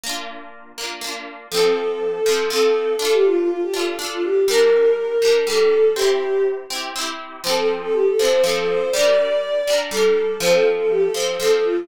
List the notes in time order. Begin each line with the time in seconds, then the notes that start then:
0.03 A#3 D4
0.09 F4
0.78 A#3 D4
0.84 F4
1.01 A#3 D4
1.07 F4
1.51 F3 C4 A4
1.57 A4
2.26 F3 C4
2.32 A4
2.50 F3 C4 A4
2.56 A4
2.99 D4 F4 A4
3.05 A4
3.12 G4
3.25 F4
3.37 F4
3.49 F4
3.63 G4
3.74 D4 F4
3.79 A4
3.99 D4 F4
4.05 A4
4.11 F4
4.24 G4
4.48 G3 D4 A#4
4.54 A#4
5.22 G3 D4
5.28 A#4
5.47 G3 D4 A4
5.53 A#4
5.95 C4 E4 G4
6.02 G4
6.70 C4 E4
6.76 G4
6.96 C4 E4
7.01 G4
7.44 F3 C4 C5
7.49 A4
7.56 A4
7.82 A4
7.93 G4
8.07 A4
8.19 F3 C4 C5
8.25 A4
8.42 F3 A4
8.47 C4 A4
8.56 A4
8.68 C5
8.91 G3 D5
8.96 D4 A#4
9.67 G3 D4
9.73 A#4
9.91 G3 D4 A4
9.97 A#4
10.40 F3 C4 C5
10.46 A4
10.53 A4
10.78 A4
10.90 G4
11.01 A4
11.14 F3 C4 C5
11.20 A4
11.40 F3 C4 A4
11.45 A4
11.51 A4
11.64 F4